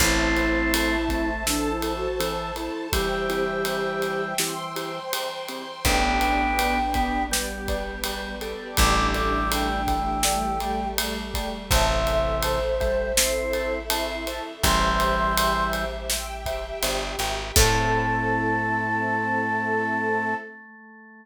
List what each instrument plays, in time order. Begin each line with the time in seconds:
0.00 electric bass (finger) A1, drawbar organ A3 C4, acoustic grand piano C4 E4 A4, flute E4, string ensemble 1 C5 E5 A5, kick, crash
0.36 acoustic grand piano C4 E4 A4, ride
0.73 acoustic grand piano C4 E4 A4, ride
1.09 drawbar organ A3, acoustic grand piano C4 E4 A4, kick, ride
1.46 drawbar organ E3, acoustic grand piano C4 E4 A4, flute D4, string ensemble 1 A4 C5 A5, snare
1.70 flute E4
1.82 acoustic grand piano C4 E4 A4, ride
1.96 flute F#4
2.20 drawbar organ E3, acoustic grand piano C4 E4 A4, ride
2.56 acoustic grand piano C4 E4 A4, flute E4, ride
2.92 drawbar organ E3 G3, acoustic grand piano C4 E4 G4, flute G4, string ensemble 1 C5 E5 G5, kick, ride
3.29 acoustic grand piano C4 E4 G4, ride
3.65 acoustic grand piano C4 E4 G4, ride
4.02 acoustic grand piano C4 E4 G4, ride
4.38 drawbar organ E3, acoustic grand piano C4 E4 G4, string ensemble 1 C5 G5 C6, snare
4.76 acoustic grand piano C4 E4 G4, ride
5.12 acoustic grand piano C4 E4 G4, ride
5.48 acoustic grand piano C4 E4 G4, ride
5.85 electric bass (finger) A1, drawbar organ B3 D4, string ensemble 1 B3 D4 G4, acoustic grand piano B4 D5 G5, flute G5, kick, ride
6.21 acoustic grand piano B4 D5 G5, ride
6.59 acoustic grand piano B4 D5 G5, ride
6.94 drawbar organ B3, acoustic grand piano B4 D5 G5, kick, ride
7.31 drawbar organ G3, string ensemble 1 G3 B3 G4, acoustic grand piano B4 D5 G5, snare
7.68 acoustic grand piano B4 D5 G5, kick, ride
8.04 drawbar organ G3, acoustic grand piano B4 D5 G5, ride
8.41 acoustic grand piano A4 D5 G5, ride
8.77 electric bass (finger) A1, drawbar organ E3 G3, string ensemble 1 A3 D4 G4, flute D6, kick, ride
9.14 acoustic grand piano A4 D5 G5, flute D6, ride
9.51 acoustic grand piano A4 D5 G5, flute G5, ride
9.87 drawbar organ E3, acoustic grand piano A4 D5 G5, kick, ride
10.23 string ensemble 1 G3 A3 G4, acoustic grand piano A4 D5 G5, snare
10.60 acoustic grand piano A4 D5 G5, ride
10.98 acoustic grand piano A4 D5 G5, ride
11.34 acoustic grand piano A4 D5 G5, kick, ride
11.71 electric bass (finger) A1, drawbar organ C3 E3, string ensemble 1 A4 C5 E5, acoustic grand piano C5 E5 A5, flute E5, kick, ride
12.07 acoustic grand piano C5 E5 A5, ride
12.43 acoustic grand piano C5 E5 A5, flute C5, ride
12.80 drawbar organ G3, acoustic grand piano C5 E5 A5, kick, ride
13.17 drawbar organ C4, string ensemble 1 E4 A4 E5, acoustic grand piano C5 E5 A5, snare
13.53 acoustic grand piano C5 E5 A5, ride
13.90 drawbar organ C4, acoustic grand piano C5 E5 A5, ride
14.27 acoustic grand piano C5 E5 A5, ride
14.63 electric bass (finger) A1, drawbar organ E3 G3, string ensemble 1 G4 C5 E5, acoustic grand piano C5 E5 G5, flute C6, kick, ride
15.00 acoustic grand piano C5 E5 G5, ride
15.37 acoustic grand piano C5 E5 G5, ride
15.73 acoustic grand piano C5 E5 G5, ride
16.10 string ensemble 1 G4 E5 G5, acoustic grand piano C5 E5 G5, snare
16.46 acoustic grand piano C5 E5 G5, kick, ride
16.83 electric bass (finger) G1, acoustic grand piano C5 E5 G5, ride
17.19 electric bass (finger) G#1, acoustic grand piano C5 E5 G5, ride
17.56 electric bass (finger) A2, drawbar organ A3, string ensemble 1 C4 E4 A4, acoustic grand piano C4 E4 A4, flute A5, kick, crash